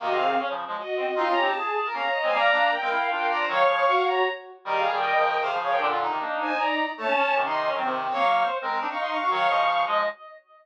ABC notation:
X:1
M:3/4
L:1/16
Q:1/4=155
K:Ebdor
V:1 name="Violin"
[Ge] [Af]3 z4 [Ge]4 | [ec'] [db]2 =a5 [db] [db] [db] [c_a] | [=db]4 [B=g]4 [Bg]2 [db]2 | [fd']6 [db]2 z4 |
[=Ge] [Af]2 [B=g]5 [Af] [Af] [Af] [Bg] | z6 [ca]2 [=db]3 z | [d=a]4 z [ec']3 z4 | [fd']3 z5 [fd'] [ec'] [fd'] [fd'] |
[fd']6 z6 |]
V:2 name="Brass Section"
B, C3 D z5 C z | F2 =G2 A3 B f2 e2 | f4 z f2 f2 f =d c | d4 G4 z4 |
B2 A2 e4 c2 d2 | =D F E10 | =A, D D3 E2 D C4 | d2 z c2 B B =D E3 G |
d2 e2 z2 e2 z4 |]
V:3 name="Clarinet"
[C,E,]4 z [D,F,]2 [F,A,] z4 | (3[CE]2 [DF]2 [CE]2 z4 [B,D] z2 [A,C] | [=G,B,]2 [B,=D]2 z [A,C] =E2 [DF]4 | [E,G,]2 [D,F,]2 z8 |
(3[E,=G,]4 [E,G,]4 [D,F,]4 [C,E,] [D,F,]3 | [B,,=D,]3 [C,E,] [B,=D]4 z4 | z4 [C,E,]4 [E,G,] [C,E,]3 | [G,B,]4 z [A,C]2 [CE] z4 |
[E,G,]2 [D,F,]4 [F,A,]2 z4 |]